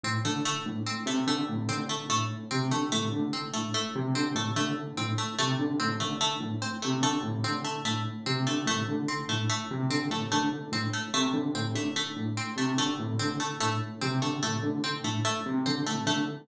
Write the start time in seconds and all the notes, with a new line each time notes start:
0.04 A2 C4
0.25 D3 A3
0.45 A3
0.66 A2
0.86 C4
1.06 C3 A3
1.27 D3 A3
1.49 A2
1.69 D3 C4
1.89 A3
2.09 A2 A3
2.51 C3 C4
2.71 D3 A3
2.92 A2 A3
3.12 D3
3.33 C4
3.53 A2 A3
3.74 A3
3.95 C3
4.14 D3 C4
4.35 A2 A3
4.56 D3 A3
4.97 A2 C4
5.18 A3
5.39 C3 A3
5.59 D3
5.80 A2 C4
6.00 D3 A3
6.21 A3
6.40 A2
6.62 C4
6.82 C3 A3
7.02 D3 A3
7.23 A2
7.44 D3 C4
7.64 A3
7.85 A2 A3
8.26 C3 C4
8.47 D3 A3
8.66 A2 A3
8.88 D3
9.08 C4
9.29 A2 A3
9.49 A3
9.71 C3
9.90 D3 C4
10.10 A2 A3
10.32 D3 A3
10.72 A2 C4
10.93 A3
11.14 C3 A3
11.33 D3
11.55 A2 C4
11.75 D3 A3
11.96 A3
12.16 A2
12.37 C4
12.56 C3 A3
12.78 D3 A3
13.00 A2
13.19 D3 C4
13.40 A3
13.60 A2 A3
14.01 C3 C4
14.21 D3 A3
14.43 A2 A3
14.63 D3
14.84 C4
15.04 A2 A3
15.25 A3
15.46 C3
15.66 D3 C4
15.86 A2 A3
16.06 D3 A3